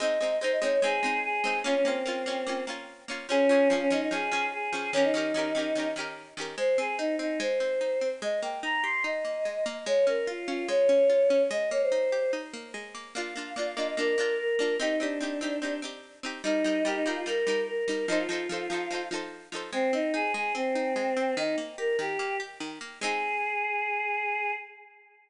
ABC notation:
X:1
M:4/4
L:1/16
Q:1/4=146
K:Ab
V:1 name="Choir Aahs"
e4 c e d d A4 A4 | D D C8 z6 | D4 F D E E A4 A4 | D E9 z6 |
c2 A2 E2 E2 c8 | e2 g2 b2 c'2 e8 | d2 B2 F2 F2 d8 | e2 d c5 z8 |
[K:Bb] f4 d f e e B4 B4 | E E D8 z6 | E4 G E F F B4 B4 | E F9 z6 |
[K:Ab] C2 E2 A2 A2 C8 | E2 z2 B2 G4 z6 | A16 |]
V:2 name="Pizzicato Strings"
[A,CE]2 [A,CE]2 [A,CE]2 [A,CE]2 [A,CE]2 [A,CE]4 [A,CE]2 | [B,DF]2 [B,DF]2 [B,DF]2 [B,DF]2 [B,DF]2 [B,DF]4 [B,DF]2 | [F,DA]2 [F,DA]2 [F,DA]2 [F,DA]2 [F,DA]2 [F,DA]4 [F,DA]2 | [E,DGB]2 [E,DGB]2 [E,DGB]2 [E,DGB]2 [E,DGB]2 [E,DGB]4 [E,DGB]2 |
A,2 C2 E2 C2 A,2 C2 E2 C2 | A,2 B,2 E2 G2 E2 B,2 A,2 B,2 | A,2 D2 F2 D2 A,2 D2 F2 D2 | A,2 B,2 E2 G2 E2 B,2 A,2 B,2 |
[K:Bb] [B,DF]2 [B,DF]2 [B,DF]2 [B,DF]2 [B,DF]2 [B,DF]4 [B,DF]2 | [CEG]2 [CEG]2 [CEG]2 [CEG]2 [CEG]2 [CEG]4 [CEG]2 | [G,EB]2 [G,EB]2 [G,EB]2 [G,EB]2 [G,EB]2 [G,EB]4 [G,EB]2 | [F,EAc]2 [F,EAc]2 [F,EAc]2 [F,EAc]2 [F,EAc]2 [F,EAc]4 [F,EAc]2 |
[K:Ab] A,2 C2 E2 A,2 C2 E2 A,2 C2 | E,2 B,2 G2 E,2 B,2 G2 E,2 B,2 | [A,CE]16 |]